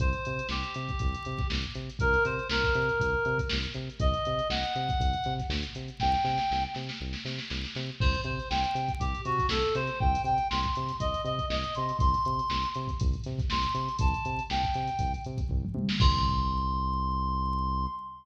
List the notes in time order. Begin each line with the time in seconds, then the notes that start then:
0.00 C2 C5, kick, closed hi-hat
0.13 closed hi-hat
0.25 C3, closed hi-hat
0.39 closed hi-hat
0.49 C2 G4, snare
0.63 closed hi-hat
0.74 C3, closed hi-hat
0.89 kick, closed hi-hat
0.99 C2, kick, closed hi-hat
1.14 closed hi-hat
1.25 C3, closed hi-hat
1.38 kick, snare, closed hi-hat
1.50 C2, snare, closed hi-hat
1.64 closed hi-hat
1.75 C3, closed hi-hat
1.89 closed hi-hat
1.99 C2 A#4, kick, closed hi-hat
2.13 snare, closed hi-hat
2.25 C3 C5, closed hi-hat
2.39 closed hi-hat
2.49 C2 A#4, snare
2.63 kick, closed hi-hat
2.75 C3, closed hi-hat
2.89 closed hi-hat
3.00 C2, kick, closed hi-hat
3.25 C3, closed hi-hat
3.38 kick, closed hi-hat
3.49 C2, snare
3.63 closed hi-hat
3.74 C3, closed hi-hat
3.90 closed hi-hat
4.00 C2 D#5, kick, closed hi-hat
4.14 closed hi-hat
4.25 C3, closed hi-hat
4.39 closed hi-hat
4.49 C2 F#5, snare
4.63 closed hi-hat
4.75 C3, closed hi-hat
4.89 kick, closed hi-hat
5.00 C2, kick, closed hi-hat
5.13 closed hi-hat
5.24 C3, snare, closed hi-hat
5.38 kick, snare, closed hi-hat
5.49 D2, snare
5.63 closed hi-hat
5.75 C3, closed hi-hat
5.88 closed hi-hat
6.00 C2 G5, kick, snare
6.14 snare
6.24 C3, snare
6.38 snare
6.51 C2, snare
6.74 C3, snare
6.89 snare
7.01 C2
7.13 snare
7.25 C3, snare
7.38 snare
7.50 C2, snare
7.64 snare
7.75 C3, snare
8.00 C2 C5, kick, crash
8.14 closed hi-hat
8.24 C3 C5, closed hi-hat
8.40 closed hi-hat
8.50 C2 G5, snare
8.64 closed hi-hat
8.75 C3, closed hi-hat
8.88 kick, closed hi-hat
9.00 C2 G4, kick, closed hi-hat
9.15 closed hi-hat
9.25 C3 F#4, closed hi-hat
9.38 kick, snare, closed hi-hat
9.49 C2 A4, snare
9.63 closed hi-hat
9.75 C3 C5, closed hi-hat
9.87 snare, closed hi-hat
10.00 C2 G5, kick
10.15 closed hi-hat
10.24 C3 G5, closed hi-hat
10.38 closed hi-hat
10.50 C2 C6, snare
10.63 kick, closed hi-hat
10.75 C3, closed hi-hat
10.88 snare, closed hi-hat
11.00 C2 D#5, kick, closed hi-hat
11.14 closed hi-hat
11.25 C3 D#5, closed hi-hat
11.39 kick, closed hi-hat
11.50 C2 D#5, snare
11.64 closed hi-hat
11.75 C3 C6, closed hi-hat
11.89 closed hi-hat
11.99 C2 C6, kick, closed hi-hat
12.14 closed hi-hat
12.25 C3, closed hi-hat
12.39 closed hi-hat
12.50 C2, snare
12.63 closed hi-hat
12.74 C3, closed hi-hat
12.88 kick, closed hi-hat
13.00 C2, kick, closed hi-hat
13.13 closed hi-hat
13.24 C3, snare, closed hi-hat
13.39 kick, snare, closed hi-hat
13.50 C2 C6, snare
13.63 closed hi-hat
13.74 C3, closed hi-hat
13.89 closed hi-hat
13.99 C2 A5, kick, closed hi-hat
14.14 closed hi-hat
14.25 C3, closed hi-hat
14.39 closed hi-hat
14.50 C2 G5, snare
14.64 kick, closed hi-hat
14.74 C3, snare, closed hi-hat
14.88 closed hi-hat
14.99 C2, kick, closed hi-hat
15.14 closed hi-hat
15.24 C3, closed hi-hat
15.38 kick, closed hi-hat
15.49 C2, kick, floor tom
15.64 mid tom
15.74 C3, high tom
15.89 snare
16.00 C2 C6, kick, crash